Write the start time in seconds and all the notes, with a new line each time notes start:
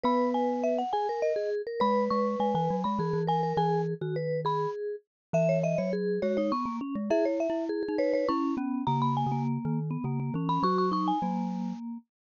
0.04 B3 B4 B5
0.34 G#5
0.63 E5
0.78 F#5
0.93 G#4 G#5
1.09 A#4
1.22 D#5
1.36 G#4
1.67 A#4
1.80 G#3 B4 B5
2.10 G#3 C#6
2.40 G#3 G#5
2.55 E3 G#5
2.70 F#3
2.84 G#3 B5
2.99 E3 G#4
3.13 E3
3.27 A#4 G#5
3.43 A#4
3.57 E3 G#4 G#5
4.01 D#3 F#4
4.16 B4
4.45 G#4 B5
5.33 E3 E5
5.49 C#5
5.63 D#5 E5
5.78 F#3 C#5
5.93 G#4
6.22 G#3 F#4 C#5
6.37 D#4 C#5
6.52 B3 C#6
6.66 A#3
6.81 C#4
6.95 G#3
7.10 E4 G#4 E5
7.25 C#5
7.40 E5
7.50 E4
7.69 G#4
7.83 G#4
7.88 D#4
7.98 B4 C#5
8.13 B4 C#5
8.29 C#4 E4 C#6
8.57 B3 C#4
8.87 C#3 A#3 A#5
9.02 B5
9.17 G#5
9.26 C#3
9.32 A#3
9.65 D#3
9.91 B3
10.04 C#3 A#3
10.20 A#3
10.34 E3 C#4
10.49 C#4 B5
10.63 F#3 F#4 C#6
10.78 C#6
10.92 D#4 C#6
11.08 G#5
11.22 F#3 A#3